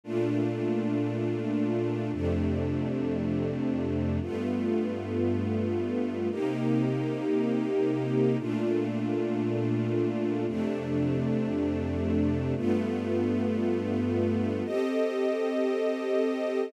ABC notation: X:1
M:4/4
L:1/8
Q:"Swing" 1/4=115
K:Cdor
V:1 name="String Ensemble 1"
[B,,A,DF]8 | [F,,C,A,D]8 | [G,,A,=B,F]8 | [C,B,EG]8 |
[B,,A,DF]8 | [F,,C,A,D]8 | [G,,A,=B,F]8 | [CGAe]8 |]